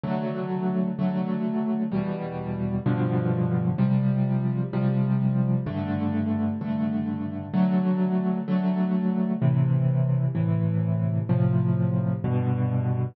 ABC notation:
X:1
M:6/8
L:1/8
Q:3/8=64
K:Em
V:1 name="Acoustic Grand Piano"
[D,F,A,]3 [D,F,A,]3 | [E,,B,,G,]3 [G,,B,,D,=F,]3 | [C,=F,G,]3 [C,F,G,]3 | [G,,D,A,]3 [G,,D,A,]3 |
[D,F,A,]3 [D,F,A,]3 | [K:Am] [A,,C,E,]3 [A,,C,E,]3 | [A,,C,F,]3 [G,,B,,D,]3 |]